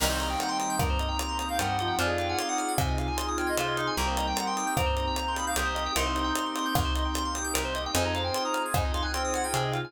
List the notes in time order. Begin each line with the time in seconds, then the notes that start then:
0.00 C2 D#3 G3 A#3 C4 D#4 G4 A#4 A#5, crash
0.06 D#4 G4
0.10 C5
0.19 D#5 A#5, closed hi-hat
0.30 G5
0.39 F#5 A#5, closed hi-hat
0.49 G5 C6
0.60 D#6, closed hi-hat
0.70 G6
0.79 G2 A#4 A#5, kick, cross-stick
0.90 C5
0.99 D#5, closed hi-hat
1.08 G5
1.19 A#5, closed hi-hat
1.29 C6
1.38 A#5 D#6, closed hi-hat
1.49 F5 G6
1.59 G2 G3 A#4 F#5, closed hi-hat
1.67 C5
1.79 F3 D#5, closed hi-hat
1.88 G5
1.99 F2 C4 D4 D#4 F4 G#4 C5 G#5, closed hi-hat
2.04 F4 G#4
2.08 D#5
2.18 F5 G5, closed hi-hat
2.29 F#5 G#5
2.39 F5 C6, closed hi-hat
2.48 F#5 D#6
2.58 F6, closed hi-hat
2.68 G#6
2.78 C3 C5 G#5, kick, cross-stick
2.88 D#5
2.98 F5, closed hi-hat
3.08 G#5
3.17 C6, closed hi-hat
3.28 D#6
3.38 G5 F6, closed hi-hat
3.47 D#5 G#6
3.57 C3 F4 C5 C6, closed hi-hat
3.68 D#5
3.76 D#4 F5, closed hi-hat
3.87 G#5
3.97 C2 G3 A#3 C4 D#4 G4 A#4 A#5
4.02 D#4 G4
4.07 C5
4.16 D#5 A#5, closed hi-hat
4.27 G5
4.36 F#5 A#5, closed hi-hat
4.46 G5 C6
4.57 D#6, closed hi-hat
4.67 G6
4.77 G2 C4 A#4 A#5, kick, cross-stick
4.86 C5
4.97 D#5, closed hi-hat
5.07 G5
5.16 A#5, closed hi-hat
5.28 C6
5.35 B5 D#6, closed hi-hat
5.47 F5 G6
5.56 C2 G4 A#4 D#6, closed hi-hat
5.65 C5
5.75 D#5, closed hi-hat
5.86 G5
5.95 C2 A#3 C4 D#4 G4 A#4 C6, closed hi-hat
6.02 D#4 G4
6.06 C5
6.16 D#5, closed hi-hat
6.24 G5
6.35 A#5, closed hi-hat
6.46 C6
6.56 D#6, closed hi-hat
6.66 G6
6.75 C2 A#4, kick, cross-stick
6.85 C5
6.95 D#5, closed hi-hat
7.05 G5
7.14 A#5, closed hi-hat
7.25 C6
7.35 D#6, closed hi-hat
7.44 G6
7.54 C2 A#4, closed hi-hat
7.65 C5
7.75 D#5, closed hi-hat
7.86 G5
7.93 F2 C4 D#4 F4 G#4 C5 D#5 G#5, closed hi-hat
8.00 F4 G#4 A#5
8.05 D#5
8.14 C5 F5, closed hi-hat
8.24 G5 G#5
8.34 C6, closed hi-hat
8.45 A#5 D#6
8.54 F6, closed hi-hat
8.66 G#6
8.74 F2 D#4 C5 G#5, kick, cross-stick
8.85 D#5
8.94 F5 C6, closed hi-hat
9.02 G#5 F#6
9.13 C4 G5 C6, closed hi-hat
9.25 D#6
9.34 F#5 F6, closed hi-hat
9.44 G5 G#6
9.54 C3 G#4 C5, closed hi-hat
9.63 D#5
9.72 F4 F5, closed hi-hat
9.85 G#5